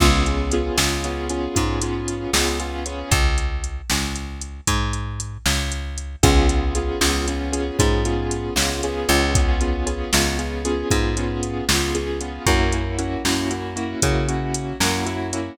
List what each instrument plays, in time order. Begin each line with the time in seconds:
0.00 electric bass (finger) C#2, acoustic grand piano B3 C#4 F4 G#4, kick, crash
0.26 acoustic grand piano B3 C#4 F4 G#4, closed hi-hat
0.52 acoustic grand piano B3 C#4 F4 G#4, closed hi-hat
0.78 electric bass (finger) C#2, acoustic grand piano B3 C#4 F4 G#4, snare
1.04 acoustic grand piano B3 C#4 F4 G#4, closed hi-hat
1.29 acoustic grand piano B3 C#4 F4 G#4, closed hi-hat
1.55 electric bass (finger) G#2, acoustic grand piano B3 C#4 F4 G#4, kick, closed hi-hat
1.81 acoustic grand piano B3 C#4 F4 G#4, closed hi-hat
2.08 closed hi-hat
2.33 electric bass (finger) C#2, acoustic grand piano B3 C#4 F4 G#4, snare
2.60 acoustic grand piano B3 C#4 F4 G#4, closed hi-hat
2.86 acoustic grand piano B3 C#4 F4 G#4, closed hi-hat
3.11 electric bass (finger) C#2, kick, closed hi-hat
3.38 closed hi-hat
3.64 closed hi-hat
3.90 electric bass (finger) C#2, snare
4.16 closed hi-hat
4.41 closed hi-hat
4.67 electric bass (finger) G#2, kick, closed hi-hat
4.93 closed hi-hat
5.20 closed hi-hat
5.46 electric bass (finger) C#2, snare
5.72 closed hi-hat
5.98 closed hi-hat
6.23 electric bass (finger) C#2, acoustic grand piano B3 C#4 F4 G#4, kick, closed hi-hat
6.49 acoustic grand piano B3 C#4 F4 G#4, closed hi-hat
6.75 acoustic grand piano B3 C#4 F4 G#4, closed hi-hat
7.01 electric bass (finger) C#2, acoustic grand piano B3 C#4 F4 G#4, snare
7.28 acoustic grand piano B3 C#4 F4 G#4, closed hi-hat
7.52 acoustic grand piano B3 C#4 F4 G#4, closed hi-hat
7.79 electric bass (finger) G#2, acoustic grand piano B3 C#4 F4 G#4, kick, closed hi-hat
8.05 acoustic grand piano B3 C#4 F4 G#4, closed hi-hat
8.31 closed hi-hat
8.56 electric bass (finger) C#2, acoustic grand piano B3 C#4 F4 G#4, snare
8.83 acoustic grand piano B3 C#4 F4 G#4, closed hi-hat
9.08 electric bass (finger) C#2, acoustic grand piano B3 C#4 F4 G#4, closed hi-hat
9.35 acoustic grand piano B3 C#4 F4 G#4, kick, closed hi-hat
9.61 acoustic grand piano B3 C#4 F4 G#4, closed hi-hat
9.86 acoustic grand piano B3 C#4 F4 G#4, closed hi-hat
10.12 electric bass (finger) C#2, acoustic grand piano B3 C#4 F4 G#4, snare
10.39 acoustic grand piano B3 C#4 F4 G#4, closed hi-hat
10.65 acoustic grand piano B3 C#4 F4 G#4, closed hi-hat
10.91 electric bass (finger) G#2, acoustic grand piano B3 C#4 F4 G#4, kick, closed hi-hat
11.17 acoustic grand piano B3 C#4 F4 G#4, closed hi-hat
11.43 closed hi-hat
11.68 electric bass (finger) C#2, acoustic grand piano B3 C#4 F4 G#4, snare
11.94 acoustic grand piano B3 C#4 F4 G#4, closed hi-hat
12.21 acoustic grand piano B3 C#4 F4 G#4, closed hi-hat
12.46 electric bass (finger) F#2, acoustic grand piano A#3 C#4 E4 F#4, kick, closed hi-hat
12.72 acoustic grand piano A#3 C#4 E4 F#4, closed hi-hat
12.98 acoustic grand piano A#3 C#4 E4 F#4, closed hi-hat
13.25 electric bass (finger) F#2, acoustic grand piano A#3 C#4 E4 F#4, snare
13.51 acoustic grand piano A#3 C#4 E4 F#4, closed hi-hat
13.76 acoustic grand piano A#3 C#4 E4 F#4, closed hi-hat
14.02 electric bass (finger) C#3, acoustic grand piano A#3 C#4 E4 F#4, kick, closed hi-hat
14.28 acoustic grand piano A#3 C#4 E4 F#4, closed hi-hat
14.54 closed hi-hat
14.80 electric bass (finger) F#2, acoustic grand piano A#3 C#4 E4 F#4, snare
15.06 acoustic grand piano A#3 C#4 E4 F#4, closed hi-hat
15.33 acoustic grand piano A#3 C#4 E4 F#4, closed hi-hat